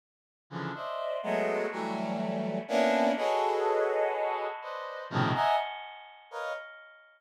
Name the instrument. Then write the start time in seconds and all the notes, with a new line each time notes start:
brass section
0.50 C#3 D3 E3 F3
0.74 C5 D5 D#5 E5
1.23 F#3 G#3 A3 B3
1.71 E3 F#3 G3 A3
2.68 A#3 B3 C#4 D4 E4
3.16 F#4 G#4 A4 B4 C#5 D#5
4.61 B4 C5 D5 D#5
5.10 A2 B2 C3 C#3 D#3 F3
5.34 D#5 E5 F#5 G#5 A#5
6.31 A#4 B4 C#5 D#5 F5